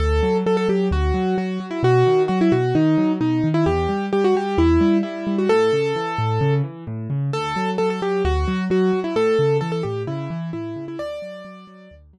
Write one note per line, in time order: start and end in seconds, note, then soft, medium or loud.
0.00 0.21 D2 medium
0.00 0.37 A4 loud
0.23 0.43 F#3 medium
0.46 0.67 F#3 medium
0.46 0.56 A4 medium
0.57 0.68 A4 loud
0.69 0.89 F#3 medium
0.69 0.88 G4 medium
0.91 1.12 D2 medium
0.91 1.36 F#4 medium
1.14 1.35 F#3 medium
1.38 1.58 F#3 medium
1.38 1.66 F#4 medium
1.60 1.81 F#3 medium
1.71 1.81 E4 medium
1.83 2.03 B2 medium
1.83 2.23 F#4 loud
2.07 2.27 D#3 medium
2.28 2.50 F#3 medium
2.28 2.39 F#4 medium
2.41 2.52 E4 loud
2.52 2.73 B2 medium
2.52 2.74 F#4 medium
2.75 2.96 D#3 medium
2.75 3.12 D#4 medium
2.98 3.18 F#3 medium
3.20 3.41 B2 medium
3.20 3.48 D#4 medium
3.44 3.64 D#3 medium
3.54 3.65 E4 loud
3.66 3.87 E2 medium
3.66 4.06 G4 medium
3.89 4.10 G3 medium
4.13 4.33 G3 medium
4.13 4.23 G4 medium
4.24 4.35 F#4 loud
4.35 4.56 G3 medium
4.35 4.58 G4 medium
4.58 4.78 E2 medium
4.58 4.98 E4 loud
4.81 5.01 G3 medium
5.03 5.25 G3 medium
5.03 5.36 E4 medium
5.27 5.47 G3 medium
5.38 5.49 F#4 medium
5.49 5.71 A2 medium
5.49 6.54 A4 loud
5.73 5.93 C#3 medium
5.96 6.16 E3 medium
6.18 6.39 A2 medium
6.41 6.62 C#3 medium
6.64 6.84 E3 medium
6.87 7.08 A2 medium
7.10 7.31 C#3 medium
7.33 7.54 D2 medium
7.33 7.70 A4 loud
7.56 7.77 F#3 medium
7.78 8.00 F#3 medium
7.78 7.89 A4 loud
7.90 8.01 A4 medium
8.02 8.22 F#3 medium
8.02 8.23 G4 medium
8.25 8.45 D2 medium
8.25 8.64 F#4 loud
8.48 8.68 F#3 medium
8.70 8.91 F#3 medium
8.70 9.00 F#4 medium
8.93 9.14 F#3 medium
9.04 9.15 E4 medium
9.16 9.36 A2 medium
9.16 9.57 A4 loud
9.39 9.60 C#3 medium
9.61 9.82 E3 medium
9.61 9.71 A4 loud
9.72 9.83 A4 medium
9.83 10.05 A2 medium
9.83 10.03 G4 medium
10.07 10.28 C#3 medium
10.07 10.50 E4 medium
10.30 10.51 E3 medium
10.53 10.74 A2 medium
10.53 10.85 E4 medium
10.76 10.97 C#3 medium
10.88 10.99 E4 medium
10.99 11.20 D2 medium
10.99 11.95 D5 loud
11.22 11.43 F#3 medium
11.45 11.65 F#3 medium
11.67 11.88 F#3 medium
11.91 12.12 D2 medium
12.13 12.19 F#3 medium